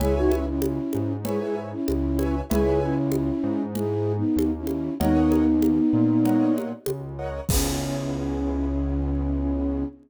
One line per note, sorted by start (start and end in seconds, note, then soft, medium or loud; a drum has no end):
0.00 0.79 C#2 loud
0.00 0.15 E4 loud
0.00 0.15 G#4 loud
0.00 0.44 B4 medium
0.00 0.44 C#5 loud
0.00 0.44 E5 loud
0.00 0.44 G#5 loud
0.00 low conga loud
0.16 0.31 D#4 loud
0.16 0.31 F#4 loud
0.31 0.46 C#4 medium
0.31 0.46 E4 loud
0.31 high conga medium
0.47 1.13 C#4 medium
0.47 1.13 E4 loud
0.62 high conga loud
0.93 1.74 G#2 medium
0.93 high conga medium
1.25 1.40 E4 medium
1.25 1.40 G#4 loud
1.25 1.69 B4 medium
1.25 1.69 C#5 loud
1.25 1.69 E5 medium
1.25 1.69 G#5 medium
1.25 low conga loud
1.41 1.56 E4 loud
1.41 1.56 G#4 loud
1.72 2.36 C#4 loud
1.72 2.36 E4 loud
1.88 2.42 C#2 medium
1.88 high conga medium
2.19 2.41 B4 medium
2.19 2.41 C#5 loud
2.19 2.41 E5 loud
2.19 2.41 G#5 medium
2.19 high conga medium
2.50 3.31 C#2 loud
2.50 2.80 E4 loud
2.50 2.80 G#4 loud
2.50 2.94 B4 loud
2.50 2.94 C#5 loud
2.50 2.94 E5 loud
2.50 2.94 G#5 loud
2.50 low conga loud
2.81 3.62 C#4 loud
2.81 3.62 E4 loud
3.12 high conga medium
3.43 4.23 G#2 loud
3.75 4.13 E4 loud
3.75 4.13 G#4 loud
3.75 low conga medium
4.17 4.51 B3 medium
4.17 4.51 D#4 loud
4.36 4.89 D#2 medium
4.36 high conga medium
4.58 4.94 C#4 medium
4.58 4.94 E4 loud
4.67 high conga medium
5.00 5.80 D#2 loud
5.00 6.53 B3 loud
5.00 6.53 D#4 loud
5.00 5.44 A#4 loud
5.00 5.44 C#5 loud
5.00 5.44 D#5 loud
5.00 5.44 F#5 loud
5.00 low conga loud
5.32 high conga medium
5.62 high conga medium
5.93 6.73 A#2 medium
6.25 6.69 A#4 medium
6.25 6.69 C#5 medium
6.25 6.69 D#5 medium
6.25 6.69 F#5 medium
6.25 low conga medium
6.58 high conga medium
6.86 7.40 C#2 medium
6.86 high conga loud
7.19 7.41 A#4 medium
7.19 7.41 C#5 medium
7.19 7.41 D#5 medium
7.19 7.41 F#5 medium
7.49 9.84 C#2 loud
7.49 9.85 B3 loud
7.49 9.85 C#4 loud
7.49 9.85 E4 loud
7.49 9.85 G#4 loud
7.49 kick loud
7.49 crash loud